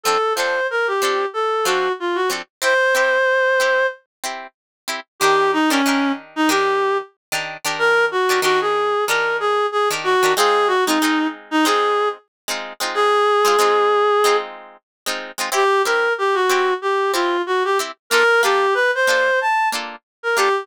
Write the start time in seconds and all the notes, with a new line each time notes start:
0.03 F3 C4 D4 A4
0.08 A4
0.35 F3 C4 D4 C5
0.40 A4
0.70 A#4
0.87 G4
1.02 F3 C4 D4 A4
1.33 A4
1.65 F3 C4 D4 F#4 A4
2.00 F4
2.15 F#4
2.30 F3 C4 D4 A4
2.62 C4 E4 G4 C5
2.95 C4 E4 G4
3.60 C4 E4 G4
4.24 C4 E4 G4
4.88 C4 E4 G4
5.20 D#3 D4 G4
5.24 A#4
5.53 D#4
5.70 D#3 C#4 D4 G4 A#4
5.86 D#3 D4 G4 A#4
6.36 D#4
6.49 D#3 D4 G4 A#4
7.32 D#3 D4 G4 A#4
7.65 D#3 D4 G4 A#4
7.79 A#4
8.11 F#4
8.29 D#3 D4 G4 A#4
8.42 D#3 D4 F#4 G4 A#4
8.61 G#4
9.07 D#3 D4 G4 A#4
9.40 G#4
9.72 G#4
9.90 D#3 D4 G4 A#4
10.04 F#4
10.23 D#3 D4 G4 A#4
10.36 G#3 C4 D#4 F4 G#4
10.67 F#4
10.86 G#3 C4 D#4
10.90 F4
11.02 G#3 C4 D#4 F4
11.51 D#4
11.65 G#3 C4 D#4 F4 G#4
12.48 G#3 C4 D#4 F4
12.80 G#3 C4 D#4 F4
12.94 G#4
13.45 G#3 C4 D#4 F4
13.59 G#3 C4 D#4 F4
14.24 G#3 C4 D#4 F4
15.06 G#3 C4 D#4 F4
15.38 G#3 C4 D#4 F4
15.52 C4 E4 G4
15.85 C4 E4 G4 A#4
16.18 G4
16.34 F#4
16.49 C4 E4 G4
16.82 G4
17.13 C4 E4 F4 G4
17.47 F#4
17.64 G4
17.79 C4 E4 G4
18.10 A#3 D4 F4 A4 A#4
18.43 A#3 D4 F4 G4 A4
18.74 B4
18.95 C5
19.07 A#3 D4 F4 A4
19.41 A5
19.72 A#3 D4 F4 A4
20.23 A#4
20.36 A#3 D4 F4 G4 A4